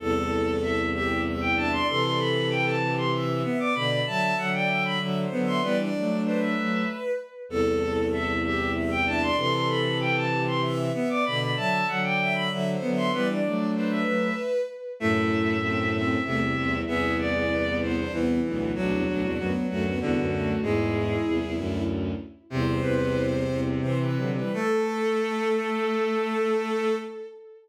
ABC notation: X:1
M:3/4
L:1/16
Q:1/4=96
K:Ador
V:1 name="Violin"
A4 e2 e2 z g a c' | c' c' b2 g a2 c' z3 d' | b b a2 f g2 b z3 c' | B z3 c e3 z4 |
A4 e2 e2 z g a c' | c' c' b2 g a2 c' z3 d' | b b a2 f g2 b z3 c' | B z3 c e3 z4 |
e6 e2 e4 | e2 d4 c2 z4 | F6 F2 F4 | ^G6 z6 |
"^rit." z2 B3 z7 | A12 |]
V:2 name="Violin"
A6 G2 e2 e d | A6 G2 e2 e d | d2 e3 d e e (3e2 c2 e2 | d d3 B6 z2 |
A6 G2 e2 e d | A6 G2 e2 e d | d2 e3 d e e (3e2 c2 e2 | d d3 B6 z2 |
E4 C2 C2 A, z C2 | ^G2 G G B,2 B, D B,2 B,2 | D2 D D B,2 A, B, B,2 A,2 | E8 z4 |
"^rit." c8 c B2 B | A12 |]
V:3 name="Violin"
z10 D2 | z10 B,2 | z10 B,2 | B, D2 D D2 z6 |
z10 D2 | z10 B,2 | z10 B,2 | B, D2 D D2 z6 |
A,4 A,4 C,4 | B,4 B,4 E,4 | F,4 F,4 D,4 | ^G,4 z8 |
"^rit." C,12 | A,12 |]
V:4 name="Violin"
[C,,E,,]12 | [C,E,]12 | [B,,D,]2 [D,F,]2 [D,F,]4 [D,F,]2 [D,F,]2 | [E,G,]2 [F,A,]4 [F,A,]2 z4 |
[C,,E,,]12 | [C,E,]12 | [B,,D,]2 [D,F,]2 [D,F,]4 [D,F,]2 [D,F,]2 | [E,G,]2 [F,A,]4 [F,A,]2 z4 |
[F,,A,,]8 [C,,E,,]2 [C,,E,,]2 | [C,,E,,]8 [C,,E,,]2 [B,,,D,,]2 | [B,,,D,,] [C,,E,,] [B,,,D,,] [C,,E,,] [D,,F,,] z [D,,F,,]2 [C,,E,,] [D,,F,,]3 | [E,,^G,,]4 [C,,E,,] [C,,E,,] [D,,F,,]4 z2 |
"^rit." [C,,E,,]2 [C,,E,,]4 [C,,E,,]2 [C,E,]2 [D,F,] [E,G,] | A,12 |]